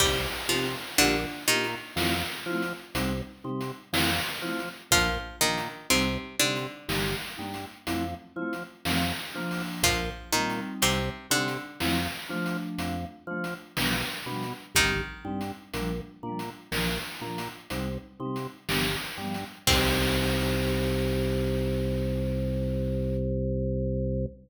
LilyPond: <<
  \new Staff \with { instrumentName = "Pizzicato Strings" } { \time 5/4 \key c \dorian \tempo 4 = 61 <g g'>8 <f f'>8 <d d'>8 <ees ees'>2~ <ees ees'>8 r4 | <f f'>8 <ees ees'>8 <c c'>8 <d d'>2~ <d d'>8 r4 | <f f'>8 <ees ees'>8 <c c'>8 <d d'>2~ <d d'>8 r4 | <ees ees'>1 r4 |
c'1~ c'4 | }
  \new Staff \with { instrumentName = "Vibraphone" } { \time 5/4 \key c \dorian <c' ees' g'>8 <c' ees' g'>8 <bes d' f' g'>8 <bes d' f' g'>8 <a c' e' f'>8 <a c' e' f'>8 <g c' ees'>8 <g c' ees'>8 <f a c' e'>8 <f a c' e'>8 | <f bes d'>8 <f bes d'>8 <g c' ees'>8 <g c' ees'>8 <g bes ees'>8 <g bes ees'>8 <f a c' e'>8 <f a c' e'>8 <f a c' ees'>8 <f bes d'>8~ | <f bes d'>8 <g c' ees'>4 <g c' ees'>8 <f a c' e'>8 <f a d'>4 <f a d'>8 <f g b d'>8 <f g b d'>8 | <g c' ees'>8 <g c' ees'>8 <f g bes d'>8 <f g bes d'>8 <f bes d'>8 <f bes d'>8 <g c' ees'>8 <g c' ees'>8 <f g b d'>8 <f g b d'>8 |
<c' ees' g'>1~ <c' ees' g'>4 | }
  \new Staff \with { instrumentName = "Drawbar Organ" } { \clef bass \time 5/4 \key c \dorian c,8 c8 bes,,8 bes,8 f,8 f8 c,8 c8 f,8 f8 | bes,,8 bes,8 c,8 c8 g,,8 g,8 f,8 f8 f,8 f8 | bes,,8 bes,8 c,8 c8 f,8 f8 f,8 f8 b,,8 b,8 | g,,8 g,8 bes,,8 bes,8 bes,,8 bes,8 c,8 c8 g,,8 g,8 |
c,1~ c,4 | }
  \new DrumStaff \with { instrumentName = "Drums" } \drummode { \time 5/4 \tuplet 3/2 { <cymc bd>8 r8 hh8 hh8 r8 hh8 sn8 r8 hh8 hh8 r8 hh8 sn8 r8 hh8 } | \tuplet 3/2 { <hh bd>8 r8 hh8 hh8 r8 hh8 sn8 r8 hh8 hh8 r8 hh8 sn8 r8 hho8 } | \tuplet 3/2 { <hh bd>8 r8 hh8 hh8 r8 hh8 sn8 r8 hh8 hh8 r8 hh8 sn8 r8 hh8 } | \tuplet 3/2 { <hh bd>8 r8 hh8 hh8 r8 hh8 sn8 r8 hh8 hh8 r8 hh8 sn8 r8 hh8 } |
<cymc bd>4 r4 r4 r4 r4 | }
>>